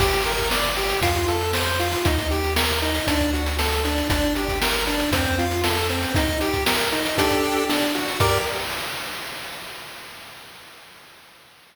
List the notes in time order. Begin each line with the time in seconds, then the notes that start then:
0.00 G1 G4, kick, crash
0.13 closed hi-hat
0.26 A#4, closed hi-hat
0.38 kick, closed hi-hat
0.51 D5, snare
0.64 closed hi-hat
0.77 G4, closed hi-hat
0.89 closed hi-hat
1.01 F2 F4, kick, closed hi-hat
1.15 kick, closed hi-hat
1.28 A4, closed hi-hat
1.41 closed hi-hat
1.53 C5, snare
1.66 closed hi-hat
1.79 F4, closed hi-hat
1.92 closed hi-hat
2.05 D#2 D#4, kick, closed hi-hat
2.18 kick, closed hi-hat
2.31 G4, closed hi-hat
2.44 closed hi-hat
2.56 A#4, snare
2.70 closed hi-hat
2.82 D#4, closed hi-hat
2.95 closed hi-hat
3.07 D2 D4, kick, closed hi-hat
3.20 kick, closed hi-hat
3.33 F#4, closed hi-hat
3.46 closed hi-hat
3.59 A4, snare
3.72 closed hi-hat
3.85 D4, closed hi-hat
3.98 closed hi-hat
4.10 G1 D4, kick, closed hi-hat
4.23 closed hi-hat
4.35 G4, closed hi-hat
4.48 kick, closed hi-hat
4.62 A#4, snare
4.74 closed hi-hat
4.87 D4, closed hi-hat
5.00 closed hi-hat
5.12 F2 C4, kick, closed hi-hat
5.25 kick, closed hi-hat
5.38 F4, closed hi-hat
5.51 closed hi-hat
5.64 A4, snare
5.77 closed hi-hat
5.89 C4, closed hi-hat
6.03 closed hi-hat
6.15 D#4, kick, closed hi-hat
6.28 kick, closed hi-hat
6.41 G4, closed hi-hat
6.53 kick, closed hi-hat
6.66 A#4, snare
6.79 closed hi-hat
6.92 D#4, closed hi-hat
7.05 closed hi-hat
7.18 D4 G4 A4, kick, closed hi-hat
7.30 kick, closed hi-hat
7.43 closed hi-hat
7.57 closed hi-hat
7.69 D4, snare
7.82 closed hi-hat
7.95 F#4, closed hi-hat
8.08 closed hi-hat
8.20 G2 G4 A#4 D5, kick, crash